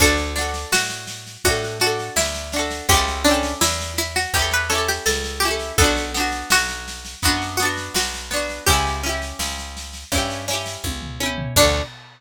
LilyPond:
<<
  \new Staff \with { instrumentName = "Pizzicato Strings" } { \time 4/4 \key d \major \tempo 4 = 83 a'4 fis'4 fis'16 r16 fis'8 e'4 | g'8 d'8 e'8 e'16 fis'16 g'16 b'16 a'16 g'16 a'8 g'8 | a'4 fis'4 fis'16 r16 fis'8 fis'4 | g'2~ g'8 r4. |
d'4 r2. | }
  \new Staff \with { instrumentName = "Acoustic Guitar (steel)" } { \time 4/4 \key d \major <d' fis' a'>8 <d' fis' a'>4. <d' fis' a'>8 <d' fis' a'>4 <d' fis' a'>8 | <cis' e' g' a'>8 <cis' e' g' a'>4. <cis' e' g' a'>8 <cis' e' g' a'>4 <cis' e' g' a'>8 | <b d' fis'>8 <b d' fis'>4. <b d' fis'>8 <b d' fis'>4 <b d' fis'>8 | <cis' e' g'>8 <cis' e' g'>4. <cis' e' g'>8 <cis' e' g'>4 <cis' e' g'>8 |
<d' fis' a'>4 r2. | }
  \new Staff \with { instrumentName = "Electric Bass (finger)" } { \clef bass \time 4/4 \key d \major d,4 a,4 a,4 d,4 | cis,4 e,4 e,4 cis,4 | b,,4 b,,4 fis,4 b,,4 | cis,4 cis,4 g,4 cis,4 |
d,4 r2. | }
  \new DrumStaff \with { instrumentName = "Drums" } \drummode { \time 4/4 <bd sn>16 sn16 sn16 sn16 sn16 sn16 sn16 sn16 <bd sn>16 sn16 sn16 sn16 sn16 sn16 sn16 sn16 | <bd sn>16 sn16 sn16 sn16 sn16 sn16 sn16 sn16 <bd sn>16 sn16 sn16 sn16 sn16 sn16 sn16 sn16 | <bd sn>16 sn16 sn16 sn16 sn16 sn16 sn16 sn16 <bd sn>16 sn16 sn16 sn16 sn16 sn16 sn16 sn16 | <bd sn>16 sn16 sn16 sn16 sn16 sn16 sn16 sn16 <bd sn>16 sn16 sn16 sn16 <bd tommh>16 tomfh16 tommh16 tomfh16 |
<cymc bd>4 r4 r4 r4 | }
>>